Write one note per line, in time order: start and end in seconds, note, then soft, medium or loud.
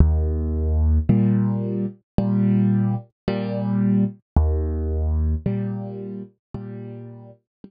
0.00 0.99 D#2 medium
1.09 1.85 A#2 medium
1.09 1.85 G3 medium
2.18 2.95 A#2 medium
2.18 2.95 G3 medium
3.28 4.04 A#2 medium
3.28 4.04 G3 medium
4.37 5.35 D#2 medium
5.46 6.22 A#2 medium
5.46 6.22 G3 medium
6.54 7.31 A#2 medium
6.54 7.31 G3 medium
7.64 7.71 A#2 medium
7.64 7.71 G3 medium